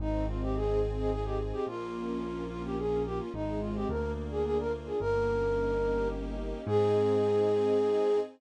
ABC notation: X:1
M:3/4
L:1/16
Q:1/4=108
K:Ab
V:1 name="Flute"
E2 F G A2 z A A G z G | F6 F G A2 G F | E2 F G B2 z A A B z A | B8 z4 |
A12 |]
V:2 name="String Ensemble 1"
C2 E2 A2 E2 C2 E2 | B,2 D2 F2 D2 B,2 D2 | A,2 C2 B,2 =D2 F2 D2 | B,2 D2 E2 G2 E2 D2 |
[CEA]12 |]
V:3 name="Acoustic Grand Piano" clef=bass
A,,,12 | B,,,12 | A,,,4 =D,,8 | G,,,12 |
A,,12 |]